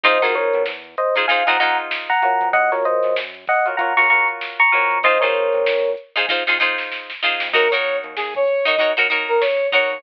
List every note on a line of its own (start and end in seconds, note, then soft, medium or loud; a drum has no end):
0.04 0.21 F2 loud
0.04 0.18 D#4 medium
0.04 0.18 F4 medium
0.04 0.18 G#4 medium
0.04 0.22 C5 loud
0.04 0.18 C5 medium
0.04 0.22 D#5 loud
0.04 kick medium
0.04 closed hi-hat loud
0.22 0.50 F2 medium
0.22 0.70 D#4 medium
0.22 0.70 F4 medium
0.22 0.35 F#4 medium
0.22 0.70 G#4 medium
0.22 0.35 A#4 loud
0.22 0.70 C5 medium
0.22 closed hi-hat medium
0.35 0.62 A#4 medium
0.35 0.62 C#5 medium
0.35 snare soft
0.35 closed hi-hat medium
0.53 0.66 B2 medium
0.53 closed hi-hat medium
0.66 0.96 E2 medium
0.66 snare medium
0.84 closed hi-hat medium
0.98 1.15 C5 medium
0.98 1.15 D#5 medium
0.98 closed hi-hat medium
1.15 1.26 D#4 medium
1.15 1.26 F4 medium
1.15 1.26 G#4 medium
1.15 1.26 C5 medium
1.15 closed hi-hat medium
1.28 1.43 D#4 medium
1.28 1.43 F4 medium
1.28 1.43 G#4 medium
1.28 1.43 C5 medium
1.28 1.45 F5 medium
1.28 1.45 G#5 medium
1.28 kick medium
1.28 closed hi-hat medium
1.47 1.76 F2 medium
1.47 1.57 D#4 medium
1.47 1.57 F4 medium
1.47 1.57 G#4 medium
1.47 1.57 C5 medium
1.47 1.59 F#5 medium
1.47 1.59 A#5 medium
1.47 snare medium
1.47 closed hi-hat medium
1.60 2.12 D#4 medium
1.60 2.12 F4 medium
1.60 2.12 G#4 medium
1.60 2.12 C5 medium
1.60 1.77 F#5 medium
1.60 1.77 A#5 loud
1.60 closed hi-hat medium
1.78 closed hi-hat medium
1.91 snare loud
2.09 2.48 F#5 medium
2.09 2.48 A#5 medium
2.09 closed hi-hat medium
2.22 2.68 F4 medium
2.22 2.68 F#4 medium
2.22 2.68 A#4 medium
2.22 2.68 C#5 medium
2.22 closed hi-hat medium
2.41 2.53 F2 medium
2.41 kick medium
2.41 closed hi-hat medium
2.53 2.71 F#2 loud
2.53 2.71 D#5 loud
2.53 2.71 F#5 loud
2.53 kick loud
2.53 closed hi-hat medium
2.72 3.00 F#2 medium
2.72 3.20 F4 medium
2.72 3.20 F#4 medium
2.72 2.84 A#4 medium
2.72 3.20 A#4 medium
2.72 2.84 C#5 medium
2.72 3.20 C#5 medium
2.72 snare soft
2.72 closed hi-hat medium
2.85 3.15 C5 medium
2.85 3.15 D#5 medium
2.85 closed hi-hat medium
3.03 3.16 F#2 medium
3.03 snare soft
3.03 closed hi-hat medium
3.16 3.46 F#2 medium
3.16 snare loud
3.34 snare soft
3.34 closed hi-hat medium
3.47 3.66 D#5 medium
3.47 3.66 F#5 medium
3.47 kick medium
3.47 snare soft
3.47 closed hi-hat medium
3.66 3.76 F4 medium
3.66 3.76 F#4 medium
3.66 3.76 A#4 medium
3.66 3.76 C#5 medium
3.66 closed hi-hat medium
3.77 3.93 F4 medium
3.77 3.93 F#4 medium
3.77 3.93 A#4 medium
3.77 3.93 C#5 medium
3.77 3.94 F#5 medium
3.77 3.94 A#5 medium
3.77 kick medium
3.77 closed hi-hat medium
3.97 4.25 C#3 medium
3.97 4.07 F4 medium
3.97 4.07 F#4 medium
3.97 4.07 A#4 medium
3.97 4.07 C#5 medium
3.97 4.09 A#5 medium
3.97 4.09 C#6 loud
3.97 snare medium
3.97 closed hi-hat medium
4.10 4.62 F4 medium
4.10 4.62 F#4 medium
4.10 4.62 A#4 medium
4.10 4.62 C#5 medium
4.10 4.27 A#5 medium
4.10 4.27 C#6 loud
4.10 closed hi-hat medium
4.28 closed hi-hat medium
4.41 snare medium
4.59 4.99 A#5 loud
4.59 4.99 C#6 loud
4.59 closed hi-hat medium
4.72 5.21 F2 loud
4.72 4.98 F4 medium
4.72 4.98 F#4 medium
4.72 4.98 A#4 medium
4.72 4.98 C#5 medium
4.72 closed hi-hat medium
4.91 kick medium
4.91 closed hi-hat medium
5.03 5.18 D#4 medium
5.03 5.18 F4 medium
5.03 5.18 G#4 medium
5.03 5.21 C5 loud
5.03 5.18 C5 medium
5.03 5.21 D#5 loud
5.03 kick loud
5.03 closed hi-hat loud
5.21 5.50 C3 medium
5.21 5.70 D#4 medium
5.21 5.70 F4 medium
5.21 5.70 G#4 medium
5.21 5.90 A#4 medium
5.21 5.70 C5 medium
5.21 5.90 C#5 medium
5.21 closed hi-hat medium
5.35 closed hi-hat medium
5.53 5.66 C3 medium
5.53 closed hi-hat medium
5.66 5.96 F2 medium
5.66 snare loud
5.84 closed hi-hat medium
5.97 closed hi-hat medium
6.16 6.26 D#4 medium
6.16 6.26 F4 medium
6.16 6.26 G#4 medium
6.16 6.26 C5 medium
6.16 closed hi-hat medium
6.29 6.43 D#4 medium
6.29 6.43 F4 medium
6.29 6.43 G#4 medium
6.29 6.43 C5 medium
6.29 kick medium
6.29 snare medium
6.47 6.75 F2 medium
6.47 6.58 D#4 medium
6.47 6.58 F4 medium
6.47 6.58 G#4 medium
6.47 6.58 C5 medium
6.47 snare medium
6.60 7.12 D#4 medium
6.60 7.12 F4 medium
6.60 7.12 G#4 medium
6.60 7.12 C5 medium
6.78 snare medium
6.92 snare medium
7.10 snare medium
7.23 7.49 D#4 medium
7.23 7.49 F4 medium
7.23 7.49 G#4 medium
7.23 7.49 C5 medium
7.23 snare medium
7.40 7.53 F2 medium
7.40 snare loud
7.53 7.71 D#2 loud
7.53 7.68 D#4 medium
7.53 7.68 F#4 medium
7.53 7.71 A#4 medium
7.53 7.68 A#4 medium
7.53 7.68 C#5 medium
7.53 kick loud
7.53 crash loud
7.71 8.00 D#2 medium
7.71 8.20 D#4 medium
7.71 8.20 F#4 medium
7.71 8.20 A#4 medium
7.71 7.97 C#5 medium
7.71 8.20 C#5 medium
7.71 closed hi-hat medium
7.84 closed hi-hat medium
8.04 8.16 D#2 medium
8.04 closed hi-hat medium
8.16 8.46 D#2 medium
8.16 8.34 G#4 medium
8.16 snare medium
8.34 8.65 C#5 medium
8.34 kick medium
8.34 closed hi-hat medium
8.48 closed hi-hat medium
8.65 8.76 D#4 medium
8.65 8.76 F#4 medium
8.65 8.76 A#4 medium
8.65 8.76 C#5 medium
8.65 8.90 D#5 medium
8.65 closed hi-hat medium
8.78 8.93 D#4 medium
8.78 8.93 F#4 medium
8.78 8.93 A#4 medium
8.78 8.93 C#5 medium
8.78 kick medium
8.78 closed hi-hat medium
8.96 9.25 D#2 medium
8.96 9.07 D#4 medium
8.96 9.07 F#4 medium
8.96 9.07 A#4 medium
8.96 9.07 C#5 medium
8.96 closed hi-hat medium
9.10 9.62 D#4 medium
9.10 9.62 F#4 medium
9.10 9.62 A#4 medium
9.10 9.62 C#5 medium
9.10 closed hi-hat medium
9.29 9.41 A#4 medium
9.29 closed hi-hat medium
9.41 9.67 C#5 medium
9.41 snare loud
9.60 closed hi-hat medium
9.72 9.98 D#4 medium
9.72 9.98 F#4 medium
9.72 9.98 A#4 medium
9.72 10.01 C#5 loud
9.72 9.98 C#5 medium
9.72 kick medium
9.72 closed hi-hat medium
9.90 10.03 D#2 medium
9.90 closed hi-hat medium